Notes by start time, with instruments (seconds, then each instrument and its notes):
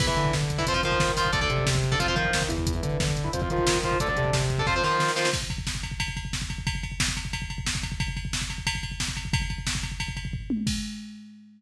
0.00 synth bass 1 E2, overdriven guitar E4 B4, kick, crash
0.07 overdriven guitar E4 B4, kick
0.17 synth bass 1 D3, kick, closed hi-hat
0.25 kick
0.33 synth bass 1 D3, kick, snare
0.42 kick
0.50 kick, closed hi-hat
0.58 overdriven guitar E4 B4, kick
0.67 synth bass 1 F2, overdriven guitar F4 C5, kick, closed hi-hat
0.74 overdriven guitar F4 C5, kick
0.83 synth bass 1 D#3, overdriven guitar F4 C5, kick, closed hi-hat
0.92 kick
1.00 synth bass 1 D#3, kick, snare
1.08 kick
1.17 overdriven guitar F4 C5, kick, open hi-hat
1.25 kick
1.33 synth bass 1 D2, overdriven guitar A4 D5, kick, closed hi-hat
1.41 overdriven guitar A4 D5, kick
1.50 synth bass 1 C3, kick, closed hi-hat
1.58 kick
1.66 synth bass 1 C3, kick, snare
1.75 kick
1.83 kick, closed hi-hat
1.92 overdriven guitar A4 D5, kick
2.00 synth bass 1 F2, overdriven guitar F4 C5, kick, closed hi-hat
2.08 overdriven guitar F4 C5, kick
2.16 synth bass 1 D#3, overdriven guitar F4 C5, kick, closed hi-hat
2.25 kick
2.33 synth bass 1 D#3, kick, snare
2.42 kick
2.48 synth bass 1 E2, overdriven guitar E4 B4, kick, closed hi-hat
2.58 kick
2.67 kick, closed hi-hat
2.75 overdriven guitar E4 B4, kick
2.83 synth bass 1 D3, kick, closed hi-hat
2.92 kick
3.00 synth bass 1 D3, kick, snare
3.08 kick
3.17 kick, closed hi-hat
3.24 overdriven guitar E4 B4, kick
3.33 synth bass 1 F2, overdriven guitar F4 C5, kick, closed hi-hat
3.42 overdriven guitar F4 C5, kick
3.50 synth bass 1 D#3, overdriven guitar F4 C5, kick, closed hi-hat
3.58 kick
3.67 synth bass 1 D#3, kick, snare
3.75 kick
3.83 overdriven guitar F4 C5, kick, closed hi-hat
3.92 kick
4.00 synth bass 1 D2, overdriven guitar A4 D5, kick, closed hi-hat
4.08 overdriven guitar A4 D5, kick
4.16 synth bass 1 C3, kick, closed hi-hat
4.25 kick
4.33 synth bass 1 C3, kick, snare
4.42 kick
4.50 kick, closed hi-hat
4.58 overdriven guitar A4 D5, kick
4.67 synth bass 1 F2, overdriven guitar F4 C5, kick, snare
4.76 overdriven guitar F4 C5
4.83 synth bass 1 D#3, overdriven guitar F4 C5, snare
5.00 synth bass 1 D#3, snare
5.08 snare
5.16 overdriven guitar F4 C5, snare
5.25 snare
5.33 kick, crash
5.42 kick
5.50 kick, ride
5.58 kick
5.67 kick, snare
5.75 kick
5.83 kick, ride
5.91 kick
6.00 kick, ride
6.08 kick
6.17 kick, ride
6.25 kick
6.33 kick, snare
6.42 kick
6.50 kick, ride
6.58 kick
6.67 kick, ride
6.75 kick
6.83 kick, ride
6.92 kick
7.00 kick, snare
7.08 kick
7.17 kick, ride
7.25 kick
7.33 kick, ride
7.42 kick
7.50 kick, ride
7.58 kick
7.66 kick, snare
7.75 kick
7.83 kick, ride
7.92 kick
8.00 kick, ride
8.08 kick
8.17 kick, ride
8.25 kick
8.33 kick, snare
8.42 kick
8.50 kick, ride
8.58 kick
8.67 kick, ride
8.75 kick
8.83 kick, ride
8.92 kick
9.00 kick, snare
9.08 kick
9.17 kick, ride
9.25 kick
9.33 kick, ride
9.42 kick
9.50 kick, ride
9.58 kick
9.67 kick, snare
9.75 kick
9.83 kick, ride
9.92 kick
10.00 kick, ride
10.08 kick
10.17 kick, ride
10.25 kick
10.33 kick, floor tom
10.50 high tom
10.67 kick, crash